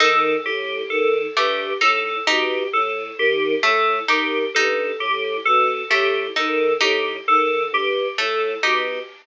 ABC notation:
X:1
M:5/4
L:1/8
Q:1/4=66
K:none
V:1 name="Choir Aahs" clef=bass
^D, A,, D, G,, A,, B,, A,, D, A,, D, | G,, A,, B,, A,, ^D, A,, D, G,, A,, B,, |]
V:2 name="Orchestral Harp"
^D z2 A, D D z2 A, D | ^D z2 A, D D z2 A, D |]
V:3 name="Electric Piano 2"
A G A G A G A G A G | A G A G A G A G A G |]